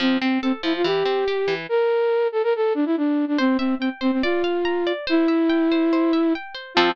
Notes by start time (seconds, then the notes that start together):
0.00 F3 C4
0.21 C4
0.42 C4 A4
0.63 F3 E4
0.76 F4
0.84 E3 G4
1.05 C4
1.28 G4
1.48 E3
1.69 A#4
2.32 A4
2.43 A#4
2.56 A4
2.75 D4
2.86 E4
2.97 D4
3.28 D4
3.38 C4 C5
3.58 C4 E5
3.79 C4 G5
4.01 C4 C5
4.12 C4
4.23 F4 D5
4.44 F5
4.65 A#5
4.87 D5
5.07 E4 C5
5.28 E5
5.49 G5
5.72 C5
5.93 C5
6.13 E5
6.35 G5
6.54 C5
6.74 F3 C4 F4 A4